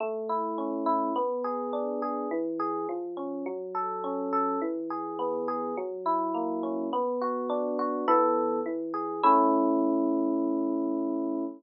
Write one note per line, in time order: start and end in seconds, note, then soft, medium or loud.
0.00 1.10 A3 medium
0.29 0.86 E4 medium
0.58 1.13 C#4 medium
0.86 1.13 E4 medium
1.16 2.25 B3 medium
1.44 2.02 G#4 medium
1.73 2.28 D4 medium
2.02 2.30 G#4 medium
2.31 2.86 E3 medium
2.59 2.87 G#4 medium
2.89 3.44 F3 medium
3.17 3.44 C#4 medium
3.46 4.56 F#3 medium
3.75 4.32 A4 medium
4.04 4.59 C#4 medium
4.33 4.60 A4 medium
4.62 5.71 E3 medium
4.90 5.47 G#4 medium
5.19 5.74 B3 medium
5.48 5.75 G#4 medium
5.77 6.87 F#3 medium
6.06 6.88 E4 medium
6.34 6.89 A#3 medium
6.63 6.91 C#4 medium
6.93 8.02 B3 medium
7.22 7.78 F#4 medium
7.50 8.04 D4 medium
7.79 8.06 F#4 medium
8.08 8.60 E3 medium
8.08 8.60 B3 medium
8.08 8.60 A4 medium
8.66 9.21 E3 medium
8.94 9.21 G#4 medium
9.23 11.44 A3 loud
9.23 11.44 C#4 medium
9.23 11.44 E4 loud